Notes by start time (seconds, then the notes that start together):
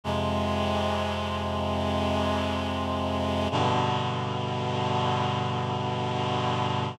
0.04 F2 C3 G#3
3.51 G2 B2 D3